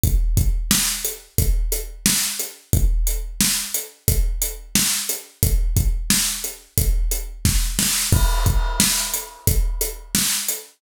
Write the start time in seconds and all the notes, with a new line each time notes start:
0.04 kick, closed hi-hat
0.37 kick, closed hi-hat
0.71 snare
1.05 closed hi-hat
1.38 kick, closed hi-hat
1.72 closed hi-hat
2.06 snare
2.39 closed hi-hat
2.73 kick, closed hi-hat
3.07 closed hi-hat
3.41 snare
3.74 closed hi-hat
4.08 kick, closed hi-hat
4.42 closed hi-hat
4.75 snare
5.09 closed hi-hat
5.43 kick, closed hi-hat
5.77 kick, closed hi-hat
6.10 snare
6.44 closed hi-hat
6.78 kick, closed hi-hat
7.11 closed hi-hat
7.45 kick, snare
7.79 snare
8.12 kick, crash
8.46 kick, closed hi-hat
8.80 snare
9.14 closed hi-hat
9.47 kick, closed hi-hat
9.81 closed hi-hat
10.15 snare
10.48 closed hi-hat